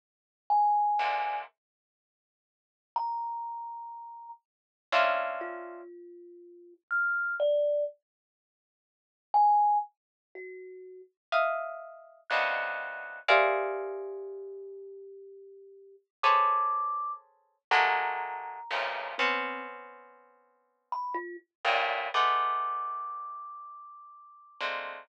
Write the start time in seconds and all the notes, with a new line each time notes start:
0.50 G#5
0.99 G#2 A#2 C3 D3
2.96 A#5
4.92 C4 C#4 D4 E4 F4
5.41 F4
6.91 F6
7.40 D5
9.34 G#5
10.35 F#4
11.32 D#5 E5 F5
12.30 B2 C3 C#3 D3 D#3 F#6
13.28 G4 G#4 A#4 C5 D5 E5 F5
16.23 G#4 A4 B4 C5 C#5 D6
17.71 F#3 G#3 A3 A#3 A#5
18.71 F2 G2 A2 A#2 C3 C#3
19.18 B3 C4 C#4
20.92 B5
21.15 F4
21.65 G2 A2 A#2
22.14 G#3 A3 B3 D6
24.61 G#3 A3 A#3 C4 D4